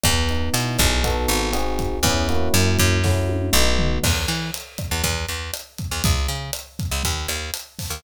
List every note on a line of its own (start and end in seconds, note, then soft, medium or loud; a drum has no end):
0.04 0.50 E2 loud
0.04 0.99 B3 medium
0.04 kick medium
0.04 cross-stick medium
0.04 closed hi-hat medium
0.29 1.02 D#4 medium
0.29 closed hi-hat soft
0.53 0.77 B2 medium
0.53 1.01 E4 medium
0.53 closed hi-hat medium
0.78 1.27 B1 loud
0.78 1.03 G#4 medium
0.78 kick medium
0.78 cross-stick medium
0.78 closed hi-hat medium
1.04 1.49 B3 medium
1.04 1.49 D#4 medium
1.04 1.49 F#4 loud
1.04 1.49 A4 medium
1.04 kick medium
1.04 closed hi-hat medium
1.28 1.99 G#1 loud
1.28 closed hi-hat medium
1.53 1.98 C4 medium
1.53 1.98 D#4 medium
1.53 1.98 F#4 loud
1.53 1.98 G#4 medium
1.53 cross-stick medium
1.53 closed hi-hat medium
1.79 kick medium
1.79 closed hi-hat medium
2.03 2.49 E2 loud
2.03 2.27 B3 medium
2.03 2.27 C#4 medium
2.03 2.27 E4 medium
2.03 2.27 G#4 medium
2.03 kick medium
2.03 closed hi-hat medium
2.28 2.98 A#3 medium
2.28 2.98 C#4 medium
2.28 2.98 E4 medium
2.28 2.98 F#4 loud
2.28 closed hi-hat medium
2.54 2.78 F#2 loud
2.54 cross-stick medium
2.54 closed hi-hat medium
2.79 3.50 F#2 loud
2.79 kick medium
2.79 closed hi-hat medium
3.04 3.49 A3 medium
3.04 3.49 C#4 medium
3.04 3.49 E4 medium
3.04 3.49 F#4 medium
3.04 kick medium
3.04 snare medium
3.29 high tom medium
3.53 3.99 B1 loud
3.53 3.98 A3 medium
3.53 3.98 B3 medium
3.53 3.98 D#4 medium
3.53 3.98 F#4 medium
3.79 floor tom medium
4.04 4.26 E2 loud
4.04 kick medium
4.04 cross-stick medium
4.04 crash loud
4.28 4.51 E3 medium
4.28 closed hi-hat medium
4.54 closed hi-hat medium
4.78 kick medium
4.78 cross-stick medium
4.78 closed hi-hat medium
4.91 5.03 E2 medium
5.04 5.26 E2 loud
5.04 kick medium
5.04 closed hi-hat medium
5.29 5.51 E2 medium
5.29 closed hi-hat medium
5.54 cross-stick medium
5.54 closed hi-hat medium
5.78 kick medium
5.78 closed hi-hat medium
5.91 6.03 E2 medium
6.04 6.27 C#2 medium
6.04 kick medium
6.04 closed hi-hat medium
6.28 6.51 C#3 medium
6.28 closed hi-hat medium
6.53 cross-stick medium
6.53 closed hi-hat medium
6.79 kick medium
6.79 closed hi-hat medium
6.91 7.03 C#2 medium
7.03 7.27 D#2 medium
7.03 kick medium
7.03 closed hi-hat medium
7.28 7.51 D#2 medium
7.28 cross-stick medium
7.28 closed hi-hat medium
7.54 closed hi-hat medium
7.79 kick medium
7.79 open hi-hat medium
7.90 8.02 D#2 medium